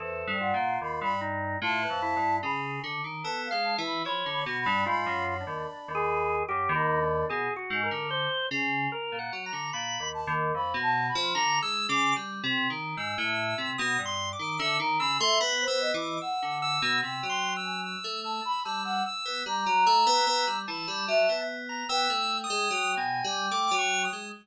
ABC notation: X:1
M:3/4
L:1/16
Q:1/4=74
K:none
V:1 name="Flute"
c2 ^f2 b b z2 a4 | b2 z2 a f a b (3b2 b2 b2 | b2 b6 z b3 | z12 |
z2 a z (3b2 a2 b2 z4 | z12 | e ^a b e z c ^d2 ^f3 z | g3 ^g z2 a b a ^f z2 |
^a6 b2 e2 z2 | g12 |]
V:2 name="Electric Piano 2"
(3E,,2 G,,2 ^A,,2 ^D,, G,,3 (3=A,,2 F,,2 G,,2 | ^C,2 D, ^D, (3B,2 ^G,2 E,2 F, =D, B,, =G,, | ^G,, ^F,,2 ^D,, z D,,3 F,, D,,3 | B,, z ^G,, D,2 z ^C,2 z ^A,, ^F, D, |
(3^A,,2 ^D,,2 D,,2 F,, B,,2 F, (3=D,2 ^G,2 ^C,2 | (3G,2 C,2 ^D,2 ^G,, A,,2 C, B,, =G,,2 D, | D, ^D, ^C, A, (3B,2 B,2 E,2 z =D,2 B,, | C, ^F,4 A,2 z G,2 z B, |
G, ^F, A, B, B, G, E, G, F, B,3 | B, A,2 ^G, (3^F,2 B,,2 =G,2 A, F,2 ^G, |]
V:3 name="Drawbar Organ"
A2 F4 ^D2 F B E2 | ^G2 z2 (3A2 f2 e2 ^c2 ^F D | (3F4 D4 ^G4 (3=G2 ^D2 =D2 | (3^G2 ^F2 ^A2 c2 z2 (3A2 ^f2 ^a2 |
b2 z6 (3^a2 e'2 d'2 | z4 e'4 (3^d'2 c'2 =d'2 | e' z e' c' (3b2 e'2 d'2 e'2 e'2 | (3e'2 c'2 e'2 e'2 e'2 e' e' e'2 |
z2 e'4 a4 z ^a | (3e'4 ^d'4 ^g4 (3=d'2 ^c'2 ^d'2 |]